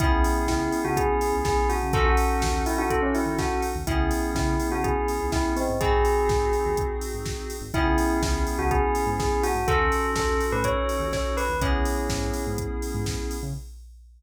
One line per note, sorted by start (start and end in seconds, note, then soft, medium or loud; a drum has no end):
0.00 0.23 C#2 medium
0.00 1.74 B3 loud
0.00 1.74 C#4 loud
0.00 0.44 E4 loud
0.00 1.74 E4 loud
0.00 1.74 G#4 loud
0.00 kick loud
0.00 closed hi-hat loud
0.24 open hi-hat medium
0.47 0.69 C#2 medium
0.47 0.80 E4 loud
0.47 kick medium
0.47 snare loud
0.72 open hi-hat medium
0.84 1.06 C#2 medium
0.84 0.96 F#4 medium
0.97 1.36 G#4 medium
0.97 kick medium
0.97 closed hi-hat loud
1.21 open hi-hat medium
1.33 1.55 C#2 medium
1.45 1.67 G#4 medium
1.45 kick loud
1.45 snare loud
1.69 1.92 F#4 medium
1.69 open hi-hat medium
1.83 1.94 C#3 medium
1.93 2.16 D#2 medium
1.93 3.68 C#4 loud
1.93 3.68 D#4 loud
1.93 3.68 F#4 loud
1.93 2.05 A4 medium
1.93 3.68 A4 loud
1.93 kick loud
1.93 closed hi-hat loud
2.06 2.59 F#4 medium
2.17 open hi-hat medium
2.42 2.65 D#2 medium
2.42 kick medium
2.42 snare loud
2.66 2.78 E4 medium
2.66 open hi-hat medium
2.78 3.00 D#3 medium
2.78 2.90 F#4 medium
2.90 3.02 A4 medium
2.90 kick medium
2.90 closed hi-hat loud
3.02 3.14 C#4 medium
3.15 3.38 E4 medium
3.15 open hi-hat medium
3.26 3.47 D#2 medium
3.39 3.62 F#4 medium
3.39 kick medium
3.39 snare loud
3.62 open hi-hat medium
3.75 3.86 D#2 medium
3.87 4.09 C#2 medium
3.87 5.61 B3 loud
3.87 5.61 C#4 loud
3.87 4.26 E4 medium
3.87 5.61 E4 loud
3.87 5.61 G#4 loud
3.87 kick loud
3.87 closed hi-hat loud
4.11 open hi-hat medium
4.35 4.56 C#3 medium
4.35 4.67 E4 medium
4.35 kick medium
4.35 snare loud
4.60 open hi-hat medium
4.70 4.92 C#3 medium
4.70 4.83 F#4 medium
4.84 5.25 G#4 medium
4.84 kick medium
4.84 closed hi-hat loud
5.08 open hi-hat medium
5.20 5.42 C#2 medium
5.32 5.52 E4 medium
5.32 kick medium
5.32 snare loud
5.56 5.76 C4 medium
5.56 open hi-hat medium
5.69 5.80 G#2 medium
5.81 6.04 G#1 medium
5.81 7.55 C4 loud
5.81 7.55 D#4 loud
5.81 7.55 F#4 loud
5.81 6.79 G#4 medium
5.81 7.55 G#4 loud
5.81 kick loud
5.81 closed hi-hat loud
6.05 open hi-hat medium
6.28 6.50 G#1 medium
6.28 kick loud
6.28 snare loud
6.53 open hi-hat medium
6.65 6.87 D#2 medium
6.77 kick medium
6.77 closed hi-hat loud
7.01 open hi-hat medium
7.14 7.36 G#1 medium
7.26 kick medium
7.26 snare loud
7.50 open hi-hat medium
7.61 7.72 G#1 medium
7.74 7.96 C#2 medium
7.74 9.48 B3 loud
7.74 9.48 C#4 loud
7.74 8.18 E4 loud
7.74 9.48 E4 loud
7.74 9.48 G#4 loud
7.74 kick loud
7.74 closed hi-hat medium
7.98 open hi-hat medium
8.22 8.44 C#2 medium
8.22 8.55 E4 medium
8.22 kick medium
8.22 snare loud
8.47 open hi-hat medium
8.58 8.80 C#2 medium
8.58 8.70 F#4 medium
8.71 9.10 G#4 medium
8.71 kick medium
8.71 closed hi-hat medium
8.95 open hi-hat medium
9.06 9.28 G#2 medium
9.20 9.41 G#4 medium
9.20 kick medium
9.20 snare loud
9.43 9.65 F#4 medium
9.43 open hi-hat medium
9.55 9.65 G#2 medium
9.68 9.90 D#2 medium
9.68 11.42 C#4 loud
9.68 11.42 D#4 loud
9.68 11.42 F#4 loud
9.68 10.10 A4 loud
9.68 11.42 A4 loud
9.68 kick loud
9.68 closed hi-hat loud
9.92 open hi-hat medium
10.16 10.39 D#2 medium
10.16 10.45 A4 medium
10.16 kick medium
10.16 snare loud
10.41 open hi-hat medium
10.52 10.74 A2 medium
10.52 10.64 B4 medium
10.64 11.08 C#5 medium
10.64 kick medium
10.64 closed hi-hat loud
10.89 open hi-hat medium
10.99 11.21 D#2 medium
11.13 11.35 C#5 medium
11.13 kick medium
11.13 snare loud
11.37 11.57 B4 medium
11.37 open hi-hat medium
11.49 11.60 D#2 medium
11.61 11.83 C#2 medium
11.61 13.35 B3 loud
11.61 12.43 C#4 medium
11.61 13.35 C#4 loud
11.61 13.35 E4 loud
11.61 13.35 G#4 loud
11.61 kick loud
11.61 closed hi-hat loud
11.85 open hi-hat medium
12.09 12.32 G#2 medium
12.09 kick medium
12.09 snare loud
12.34 open hi-hat medium
12.47 12.68 G#2 medium
12.58 kick medium
12.58 closed hi-hat loud
12.82 open hi-hat medium
12.94 13.16 G#2 medium
13.06 kick medium
13.06 snare loud
13.31 open hi-hat medium
13.43 13.54 C#3 medium